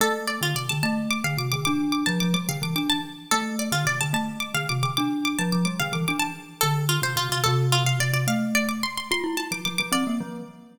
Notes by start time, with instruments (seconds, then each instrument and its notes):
0.01 glockenspiel A3, harpsichord A4
0.27 harpsichord D5
0.41 glockenspiel D3, harpsichord F4
0.55 glockenspiel C3, harpsichord D5
0.69 glockenspiel D3, harpsichord A5
0.83 glockenspiel A3, harpsichord A5
1.11 harpsichord D6
1.24 glockenspiel D3, harpsichord F5
1.37 glockenspiel C3, harpsichord D6
1.52 glockenspiel D3, harpsichord D6
1.65 glockenspiel D4, harpsichord D6
1.92 harpsichord D6
2.06 glockenspiel F3, harpsichord A5
2.20 glockenspiel F3, harpsichord D6
2.34 glockenspiel G3, harpsichord D6
2.49 glockenspiel D3, harpsichord F5
2.62 glockenspiel E3, harpsichord D6
2.76 glockenspiel D4, harpsichord D6
2.90 harpsichord A5
3.31 glockenspiel A3, harpsichord A4
3.59 harpsichord D5
3.72 glockenspiel D3, harpsichord F4
3.85 glockenspiel C3, harpsichord D5
4.01 glockenspiel D3, harpsichord A5
4.13 glockenspiel A3, harpsichord A5
4.40 harpsichord D6
4.54 glockenspiel D3, harpsichord F5
4.69 glockenspiel C3, harpsichord D6
4.83 glockenspiel D3, harpsichord D6
4.97 glockenspiel D4, harpsichord D6
5.25 harpsichord D6
5.39 glockenspiel F3, harpsichord A5
5.52 glockenspiel F3, harpsichord D6
5.65 glockenspiel G3, harpsichord D6
5.80 glockenspiel D3, harpsichord F5
5.93 glockenspiel E3, harpsichord D6
6.08 glockenspiel D4, harpsichord D6
6.19 harpsichord A5
6.61 glockenspiel D3, harpsichord A4
6.89 harpsichord F4
7.02 glockenspiel C3, harpsichord C5
7.16 glockenspiel C3, harpsichord F4
7.29 glockenspiel C3, harpsichord F4
7.44 glockenspiel C3, harpsichord A4
7.72 harpsichord F4
7.85 glockenspiel C3, harpsichord F5
8.00 glockenspiel C3, harpsichord D5
8.13 glockenspiel C3, harpsichord D5
8.27 glockenspiel A3, harpsichord F5
8.55 harpsichord D5
8.69 harpsichord D6
8.83 harpsichord C6
8.97 harpsichord C6
9.11 glockenspiel F4, harpsichord C6
9.24 glockenspiel E4
9.37 glockenspiel E4, harpsichord A5
9.51 glockenspiel F3, harpsichord D6
9.65 glockenspiel F3, harpsichord D6
9.78 glockenspiel F3, harpsichord D6
9.92 glockenspiel C4, harpsichord D5
10.07 glockenspiel A#3
10.21 glockenspiel F3